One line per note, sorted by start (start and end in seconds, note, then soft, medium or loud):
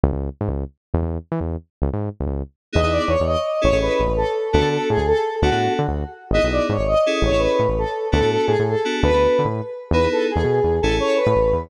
0.04 0.12 C#2 medium
0.13 0.29 C#2 medium
0.41 0.49 G#2 medium
0.48 0.64 C#2 medium
0.94 1.02 E2 medium
1.02 1.18 E2 medium
1.32 1.40 E3 medium
1.40 1.57 E2 medium
1.82 1.90 C#2 medium
1.93 2.09 G#2 medium
2.20 2.26 C#2 medium
2.27 2.43 C#2 medium
2.73 2.82 E2 medium
2.73 2.80 B3 loud
2.73 2.80 D#4 medium
2.73 2.80 E4 loud
2.73 2.80 G#4 loud
2.73 2.91 D#5 medium
2.83 2.99 E2 medium
2.83 3.12 B3 medium
2.83 3.12 D#4 medium
2.83 3.12 E4 medium
2.83 3.12 G#4 medium
2.92 3.09 D5 medium
3.08 3.16 E2 medium
3.08 3.24 C#5 medium
3.20 3.36 E2 medium
3.27 3.61 D#5 medium
3.61 3.72 A1 medium
3.61 3.69 C#4 medium
3.61 3.69 E4 medium
3.61 3.69 G#4 medium
3.61 3.69 A4 medium
3.61 3.78 C#5 medium
3.72 3.89 A1 medium
3.72 4.01 C#4 medium
3.72 4.01 E4 medium
3.72 4.01 G#4 medium
3.72 4.01 A4 medium
3.81 4.12 B4 medium
4.00 4.07 A1 medium
4.08 4.24 A1 medium
4.17 4.49 A4 medium
4.52 4.62 D2 medium
4.52 4.60 B3 loud
4.52 4.60 D4 loud
4.52 4.60 F#4 loud
4.52 4.69 A4 medium
4.52 4.60 A4 medium
4.61 4.78 D3 medium
4.61 4.90 B3 medium
4.61 4.90 D4 medium
4.61 4.90 F#4 medium
4.61 4.90 A4 medium
4.71 4.89 A4 medium
4.90 4.98 A2 medium
4.90 5.06 G#4 medium
4.97 5.13 D2 medium
5.07 5.36 A4 medium
5.42 5.50 D2 medium
5.42 5.50 B3 medium
5.42 5.50 D4 loud
5.42 5.50 F#4 loud
5.42 5.73 F#4 medium
5.42 5.50 A4 loud
5.51 5.68 A2 medium
5.51 5.79 B3 medium
5.51 5.79 D4 medium
5.51 5.79 F#4 medium
5.51 5.79 A4 medium
5.79 5.87 D3 medium
5.88 6.04 D2 medium
6.31 6.39 G#1 medium
6.31 6.41 B3 loud
6.31 6.41 D#4 loud
6.31 6.41 E4 loud
6.31 6.41 G#4 medium
6.31 6.47 D#5 medium
6.43 6.59 B1 medium
6.43 6.72 B3 medium
6.43 6.72 D#4 medium
6.43 6.72 E4 medium
6.43 6.72 G#4 medium
6.52 6.68 D5 medium
6.69 6.77 G#2 medium
6.69 6.87 C#5 medium
6.79 6.95 G#1 medium
6.87 7.17 D#5 medium
7.06 7.31 C#4 loud
7.06 7.31 E4 loud
7.06 7.31 G#4 loud
7.06 7.31 A4 medium
7.22 7.30 A1 medium
7.22 7.41 C#5 medium
7.31 7.47 A1 medium
7.31 7.61 C#4 medium
7.31 7.61 E4 medium
7.31 7.61 G#4 medium
7.31 7.61 A4 medium
7.39 7.68 B4 medium
7.59 7.67 A2 medium
7.69 7.85 A1 medium
7.78 8.07 A4 medium
8.12 8.21 D2 medium
8.12 8.19 B3 loud
8.12 8.19 D4 medium
8.12 8.19 F#4 loud
8.12 8.19 A4 medium
8.12 8.30 A4 medium
8.21 8.37 A2 medium
8.21 8.51 B3 medium
8.21 8.51 D4 medium
8.21 8.51 F#4 medium
8.21 8.51 A4 medium
8.30 8.46 A4 medium
8.46 8.56 A2 medium
8.46 8.63 G#4 medium
8.59 8.75 A2 medium
8.68 9.00 A4 medium
8.85 9.10 B3 loud
8.85 9.10 D4 medium
8.85 9.10 F#4 medium
8.85 9.10 A4 loud
9.03 9.10 D2 medium
9.03 9.48 B4 medium
9.11 9.27 D2 medium
9.11 9.42 B3 medium
9.11 9.42 D4 medium
9.11 9.42 F#4 medium
9.11 9.42 A4 medium
9.39 9.47 D3 medium
9.45 9.61 A2 medium
9.91 10.07 E2 medium
9.91 10.00 B3 medium
9.91 10.00 D#4 loud
9.91 10.00 E4 medium
9.91 10.00 G#4 medium
9.91 10.08 B4 medium
10.03 10.32 B3 medium
10.03 10.32 D#4 medium
10.03 10.32 E4 medium
10.03 10.32 G#4 medium
10.12 10.27 A4 medium
10.30 10.76 G#4 medium
10.36 10.44 E2 medium
10.44 10.60 B2 medium
10.64 10.80 E2 medium
10.81 11.00 A1 medium
10.81 10.90 C#4 loud
10.81 10.90 E4 loud
10.81 10.90 G#4 medium
10.81 10.96 A4 medium
10.81 10.90 A4 loud
10.90 11.19 C#4 medium
10.90 11.19 E4 medium
10.90 11.19 G#4 medium
10.90 11.19 A4 medium
11.00 11.17 C#5 medium
11.16 11.62 B4 medium
11.27 11.35 A2 medium
11.36 11.52 A1 medium
11.53 11.69 E2 medium